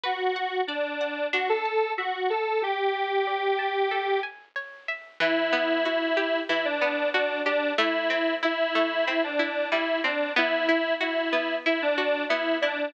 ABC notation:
X:1
M:4/4
L:1/16
Q:1/4=93
K:Bm
V:1 name="Lead 1 (square)"
F4 D4 F A3 F2 A2 | G10 z6 | [K:Em] E4 E4 E D3 D2 D2 | E4 E4 E D3 E2 D2 |
E4 E4 E D3 E2 D2 |]
V:2 name="Acoustic Guitar (steel)"
B2 f2 d2 f2 D2 a2 e2 f2 | G2 a2 d2 a2 A2 ^g2 c2 e2 | [K:Em] E,2 B,2 F2 G2 E,2 B,2 F2 G2 | A,2 C2 E2 A,2 C2 E2 G,2 C2 |
B,2 E2 F2 B,2 E2 F2 B,2 E2 |]